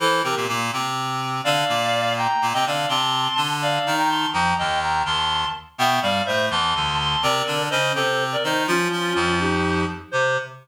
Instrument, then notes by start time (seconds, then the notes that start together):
clarinet
0.00 E3 E4 A4 C5
0.23 C3 C4 G4 A#4
0.36 A#2 A#3
0.48 A#2 A#3
0.73 C3 C4
1.44 D3 D4 D5 F5
1.69 A#2 A#3
2.17 G5 A#5
2.42 A#2 A#3
2.53 C3 C4 D#5 G5
2.66 D3 D4 D5 F5
2.89 C3 C4 A5 C6
3.37 D3 D4
3.62 D5 F5
3.86 D#3 D#4
3.98 G5 A#5
4.09 A5 C6
4.33 F2 F3 G5 A#5
4.58 D#2 D#3 D#5 G5
4.82 G5 A#5
5.05 D#2 D#3 A5 C6
5.78 B2 B3 E5 G5
6.02 G2 G3 D5 F5
6.26 A2 A3 C5 E5
6.50 E2 E3 A5 C6
6.75 D2 D3
6.99 A5 C6
7.22 C3 C4 A#4 D5
7.47 D3 D4
7.70 C#3 C#4 C5 D#5
7.95 C3 C4 A4 C5
8.32 A#4 D5
8.43 D#3 D#4 C5 D#5
8.67 F3 C#4 F4
8.92 F3 F4
9.15 F2 F3
9.40 D#4 G4
10.11 C3 C5